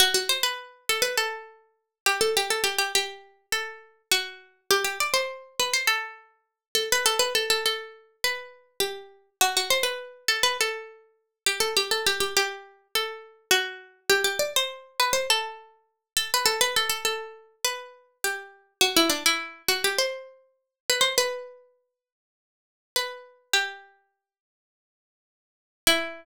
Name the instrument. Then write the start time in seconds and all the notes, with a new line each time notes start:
harpsichord
0.00 F#4
0.14 F#4
0.29 C5
0.43 B4
0.89 A4
1.02 B4
1.17 A4
2.06 G4
2.21 A4
2.37 G4
2.50 A4
2.64 G4
2.78 G4
2.95 G4
3.52 A4
4.12 F#4
4.71 G4
4.84 G4
5.00 D5
5.14 C5
5.60 B4
5.74 C5
5.87 A4
6.75 A4
6.92 B4
7.06 A4
7.19 B4
7.35 A4
7.50 A4
7.66 A4
8.24 B4
8.80 G4
9.41 F#4
9.57 F#4
9.70 C5
9.83 B4
10.28 A4
10.43 B4
10.61 A4
11.46 G4
11.60 A4
11.77 G4
11.91 A4
12.06 G4
12.20 G4
12.37 G4
12.95 A4
13.51 F#4
14.10 G4
14.24 G4
14.39 D5
14.56 C5
15.00 B4
15.13 C5
15.30 A4
16.17 A4
16.34 B4
16.46 A4
16.61 B4
16.76 A4
16.89 A4
17.05 A4
17.64 B4
18.24 G4
18.81 F#4
18.96 E4
19.10 D4
19.26 E4
19.68 F#4
19.84 G4
19.98 C5
20.90 B4
21.01 C5
21.18 B4
22.96 B4
23.53 G4
25.87 E4